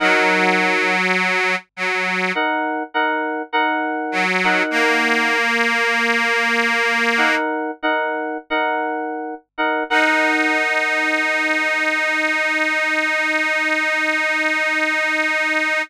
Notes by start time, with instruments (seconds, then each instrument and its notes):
0.00 accordion F#3, electric piano 2 D#4 A#4 F#5
1.76 accordion F#3
2.35 electric piano 2 D#4 A#4 F#5
2.94 electric piano 2 D#4 A#4 F#5
3.53 electric piano 2 D#4 A#4 F#5
4.12 accordion F#3
4.44 electric piano 2 D#4 A#4 F#5
4.71 accordion A#3
7.18 electric piano 2 D#4 A#4 F#5
7.83 electric piano 2 D#4 A#4 F#5
8.50 electric piano 2 D#4 A#4 F#5
9.58 electric piano 2 D#4 A#4 F#5
9.90 accordion D#4, electric piano 2 D#4 A#4 F#5